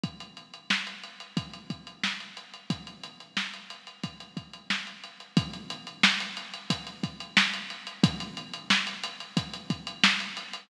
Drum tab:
HH |xxxx-xxxxxxx-xxx|xxxx-xxxxxxx-xxx|xxxx-xxxxxxx-xxx|xxxx-xxxxxxx-xxx|
SD |----o-------oo--|----o-------o---|----o-------o---|----o-------o---|
BD |o-------o-o-----|o-------o-o-----|o-------o-o-----|o-------o-o-----|